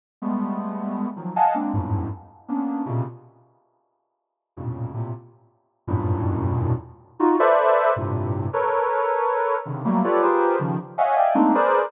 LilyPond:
\new Staff { \time 9/8 \tempo 4. = 106 r8 <g gis a b>2~ <g gis a b>8 <dis f fis>8 <dis'' f'' fis'' gis'' a''>8 <gis ais c' d'>8 | <e, f, fis, g, gis, a,>4 r4 <ais b cis' d'>4 <ais, b, c cis>8 r4 | r2. <f, g, a, ais, b, cis>4 <a, ais, c>8 | r2 <e, fis, g, a, ais, b,>2~ <e, fis, g, a, ais, b,>8 |
r4 <dis' f' fis'>8 <a' b' c'' d'' e''>4. <g, a, ais, c>4. | <a' ais' b' cis''>2. <c cis d dis>8 <fis g a ais>8 <f' g' a' b' cis'' d''>8 | <f' g' gis' ais' b' c''>4 <cis dis f>8 r8 <cis'' dis'' e'' f'' fis'' gis''>8 <d'' dis'' e'' f'' g'' gis''>8 <gis a ais c' d' dis'>8 <gis' ais' b' c'' d''>4 | }